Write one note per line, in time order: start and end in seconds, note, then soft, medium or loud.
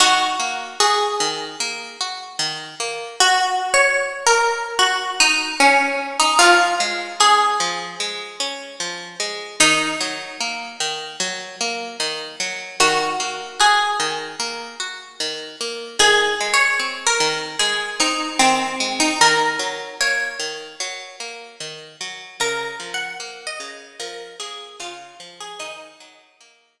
0.00 0.36 D#3 loud
0.00 0.67 F#4 loud
0.40 0.76 A#3 medium
0.80 1.16 F#4 loud
0.80 2.25 G#4 medium
1.20 1.56 D#3 medium
1.60 1.96 A#3 loud
2.01 2.37 F#4 medium
2.39 2.75 D#3 loud
2.80 3.16 A#3 medium
3.20 3.70 F#4 loud
3.74 4.25 C#5 loud
4.27 4.75 A#4 medium
4.79 5.11 F#4 medium
5.20 5.55 D#4 loud
5.60 6.18 C#4 medium
6.20 6.39 D#4 medium
6.39 6.76 F3 loud
6.39 7.17 F4 loud
6.80 7.16 G#3 medium
7.20 7.56 C#4 medium
7.20 8.51 G#4 medium
7.60 7.96 F3 medium
8.00 8.36 G#3 medium
8.40 8.76 C#4 loud
8.80 9.16 F3 medium
9.20 9.56 G#3 medium
9.60 9.96 D#3 loud
9.60 10.70 D#4 loud
10.01 10.37 F#3 medium
10.41 10.77 A#3 medium
10.80 11.16 D#3 medium
11.20 11.56 F#3 loud
11.61 11.97 A#3 medium
12.00 12.36 D#3 loud
12.40 12.76 F#3 medium
12.80 13.16 D#3 loud
12.80 13.46 F#4 medium
13.20 13.56 A#3 medium
13.60 13.96 F#4 medium
13.60 15.13 G#4 medium
14.00 14.36 D#3 medium
14.40 14.76 A#3 medium
14.80 15.16 F#4 medium
15.20 15.56 D#3 medium
15.61 15.97 A#3 medium
15.99 16.35 D#3 loud
15.99 16.48 G#4 loud
16.41 16.77 G#3 medium
16.54 17.02 C#5 medium
16.80 17.16 C4 medium
17.07 17.57 A#4 medium
17.20 17.56 D#3 medium
17.59 17.96 G#3 medium
17.59 17.98 G#4 medium
18.00 18.36 C4 medium
18.00 18.39 D#4 medium
18.39 18.76 D#3 medium
18.39 18.89 C4 medium
18.80 19.16 G#3 medium
19.00 19.19 D#4 medium
19.21 19.57 D#3 loud
19.21 19.94 A#4 loud
19.59 19.95 F#3 medium
20.01 20.37 A#3 medium
20.01 21.30 C#5 medium
20.39 20.76 D#3 medium
20.80 21.16 F#3 loud
21.20 21.56 A#3 medium
21.60 21.96 D#3 medium
22.01 22.37 F#3 medium
22.40 22.76 C#3 loud
22.40 22.91 A#4 loud
22.80 23.16 F3 medium
22.94 23.44 F#5 medium
23.20 23.56 A#3 medium
23.47 23.91 D#5 loud
23.60 23.96 C#3 medium
24.00 24.36 F3 medium
24.00 24.39 A#4 medium
24.40 24.76 A#3 medium
24.40 24.78 G#4 medium
24.80 25.16 C#3 medium
24.80 25.36 F4 medium
25.20 25.56 F3 loud
25.41 25.60 G#4 medium
25.59 25.95 D#3 loud
25.59 26.80 D#4 loud
26.00 26.36 F#3 medium
26.41 26.77 A#3 medium
26.80 26.80 D#3 medium